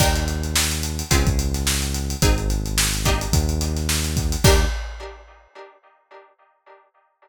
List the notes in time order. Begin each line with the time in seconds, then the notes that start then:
0.00 D#2 D4 D#4 G4 A#4, kick, crash
0.16 closed hi-hat
0.28 closed hi-hat
0.44 closed hi-hat
0.56 snare
0.71 closed hi-hat
0.83 closed hi-hat
0.99 closed hi-hat
1.11 C#2 C4 C#4 F4 G#4, kick, closed hi-hat
1.27 kick, closed hi-hat
1.39 closed hi-hat
1.54 snare, closed hi-hat
1.67 snare
1.82 closed hi-hat
1.94 closed hi-hat
2.10 closed hi-hat
2.22 G#1 C4 D#4 G#4, kick, closed hi-hat
2.38 closed hi-hat
2.50 closed hi-hat
2.66 closed hi-hat
2.78 snare
2.94 closed hi-hat
3.05 A#3 D4 D#4 G4, kick, closed hi-hat
3.21 closed hi-hat
3.32 D#2, kick, closed hi-hat
3.49 closed hi-hat
3.61 closed hi-hat
3.77 snare, closed hi-hat
3.89 snare
4.04 snare, closed hi-hat
4.17 kick, closed hi-hat
4.32 closed hi-hat
4.44 D#2 D4 D#4 G4 A#4, kick, crash